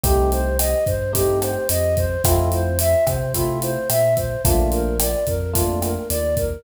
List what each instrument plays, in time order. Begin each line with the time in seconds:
0.04 synth bass 1 C2, electric piano 1 A3 C4 D#4 G4, flute G4, kick, closed hi-hat
0.32 flute C5, closed hi-hat
0.59 flute D#5, cross-stick, closed hi-hat
0.86 synth bass 1 G2, flute C5, kick, closed hi-hat
1.13 electric piano 1 A3 C4 D#4 G4, flute G4, kick, closed hi-hat
1.42 flute C5, cross-stick, closed hi-hat
1.69 synth bass 1 F2, flute D#5, closed hi-hat
1.97 flute C5, kick, closed hi-hat
2.24 synth bass 1 F2, electric piano 1 A3 C4 E4 F4, flute F4, kick, cross-stick, closed hi-hat
2.52 flute C5, closed hi-hat
2.79 flute E5, closed hi-hat
3.07 synth bass 1 C3, flute C5, kick, cross-stick, closed hi-hat
3.34 electric piano 1 A3 C4 E4 F4, flute F4, kick, closed hi-hat
3.62 flute C5, closed hi-hat
3.89 synth bass 1 A#2, flute E5, cross-stick, closed hi-hat
4.17 flute C5, kick, closed hi-hat
4.44 synth bass 1 A#1, electric piano 1 A3 A#3 D4 F4, flute F4, kick, closed hi-hat
4.72 flute A#4, closed hi-hat
5.00 flute D5, cross-stick, closed hi-hat
5.27 synth bass 1 F2, flute A#4, kick, closed hi-hat
5.53 electric piano 1 A3 A#3 D4 F4, flute F4, kick, closed hi-hat
5.82 flute A#4, cross-stick, closed hi-hat
6.10 synth bass 1 D#2, flute D5, closed hi-hat
6.37 flute A#4, kick, closed hi-hat